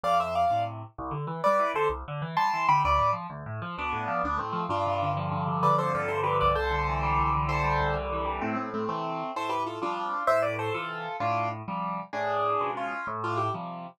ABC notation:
X:1
M:6/8
L:1/8
Q:3/8=129
K:Am
V:1 name="Acoustic Grand Piano"
[df] [ce] [df]2 z2 | [K:C] z3 [Bd]2 [Ac] | z3 [ac']2 [gb] | [Bd]2 z4 |
[B,D]3 [B,D] [A,C]2 | [DF]3 z3 | [Bd] [Ac] [FA] [Ac] [GB] [Bd] | [Ac]6 |
[Ac]3 z3 | [K:Am] [A,C] [A,C] [A,C] [A,C]3 | [Ac] [GB] [FA] [DF]3 | [ce] [Bd] [Ac] [FA]3 |
[DF]2 z4 | [D^G]4 [^C^E]2 | z [DF] [EG] z3 |]
V:2 name="Acoustic Grand Piano" clef=bass
F,,3 [A,,C,]3 | [K:C] C,, D, E, G, E, D, | C,, D, E, G, E, D, | D,, A,, F, D,, A,, F, |
D,, A,, F, D,, A,, F, | G,, C, D, F, G,, C, | D, F, G,, C, D, C,,- | C,, D, E, G, C,, D, |
E, G, C,, D, E, G, | [K:Am] A,,3 [C,E,]3 | A,,3 [C,F,G,]3 | A,,3 [C,E,]3 |
A,,3 [C,F,G,]3 | A,,3 [B,,^C,^E,^G,]3 | A,,3 [C,F,G,]3 |]